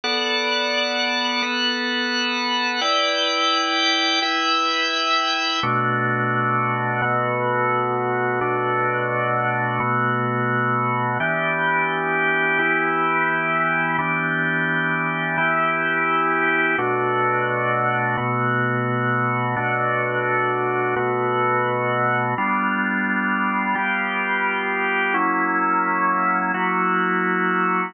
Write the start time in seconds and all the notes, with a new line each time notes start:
0.04 B3 A4 D5 F#5
1.42 B3 A4 B4 F#5
2.81 E4 B4 D5 G5
4.22 E4 B4 E5 G5
5.63 B2 A3 D4 F#4
7.02 B2 A3 B3 F#4
8.41 B2 A3 D4 F#4
9.80 B2 A3 B3 F#4
11.20 E3 B3 D4 G4
12.59 E3 B3 E4 G4
13.98 E3 B3 D4 G4
15.37 E3 B3 E4 G4
16.78 B2 A3 D4 F#4
18.17 B2 A3 B3 F#4
19.56 B2 A3 D4 F#4
20.96 B2 A3 B3 F#4
22.38 G3 B3 D4 F4
23.75 G3 B3 F4 G4
25.14 F#3 A#3 C#4 E4
26.54 F#3 A#3 E4 F#4